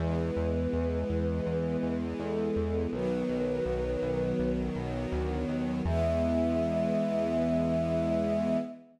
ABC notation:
X:1
M:4/4
L:1/8
Q:1/4=82
K:E
V:1 name="Choir Aahs"
B6 A2 | B5 z3 | e8 |]
V:2 name="String Ensemble 1"
[E,G,B,]8 | [D,F,B,]8 | [E,G,B,]8 |]
V:3 name="Synth Bass 1" clef=bass
E,, E,, E,, E,, E,, E,, E,, E,, | B,,, B,,, B,,, B,,, B,,, B,,, =D,, ^D,, | E,,8 |]